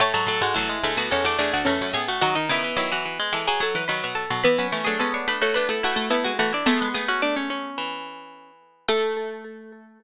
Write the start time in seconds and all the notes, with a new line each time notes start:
0.00 A2 A3 A4 C#5 A5
0.14 G#2 F#3 A4 A5
0.27 A2 F#3 A4
0.41 G#2 G#3 F#4 A4 F#5
0.54 E2 F#3 A3 E4 A4
0.69 G#3
0.83 D2 G#3 A3 A4
0.97 D2 B3 F#4
1.11 E2 G#3 C#4 A4 C#5
1.24 E2 A3 D4 D5
1.39 E2 A3 D4 G#4 D5
1.53 D2 D4 F#4 D5
1.65 E2 A3 C#4 A4 A5
1.81 F#2
1.93 A2 B3 G#4 G#5
2.08 A3 F#4 F#5
2.21 D#3 F#3 D#4 F#4 F#5
2.35 D#3 D#4 D#5
2.49 C#3 D#3 B3 E4 E5
2.64 E3
2.77 D#3 F#3 E4 E5
2.92 E3 F#4 F#5
3.05 E3
3.19 G#3
3.33 E3 G#3 A4 A5
3.47 F#3 G#4 G#5
3.60 F#3 A4 A5
3.75 E3 B4 B5
3.88 D#3 F#3 B4 B5
4.04 B2
4.15 A4 A5
4.30 B2 F#3
4.44 E3 B3 E4 B4 B5
4.58 F#3 C#4 B4 B5
4.72 E3 A3 C#4
4.85 F#3 A3 D4 G#4 G#5
4.99 G#3 B3 C#4 A4 A5
5.14 D4 C#5 C#6
5.28 A3 D4 B4 B5
5.41 A3 F#4 C#5 C#6
5.54 A3 B3 D4 B4 B5
5.69 A3 E4 A4 A5
5.83 A3 E4 F#4 F#5
5.96 A3
6.10 A3 B3 E4 E5
6.24 G#3 F#4 F#5
6.39 E3 A3 F#4 F#5
6.53 D4 E4 D5
6.66 G#3 A3 B3 A4 A5
6.81 G#3 B3
6.94 A3 B3 G#4 G#5
7.08 C#4 F#4 F#5
7.22 A3 D4 D5
7.36 C#4 C#5
7.50 C#4 C#5
7.78 E3
8.88 A3 A4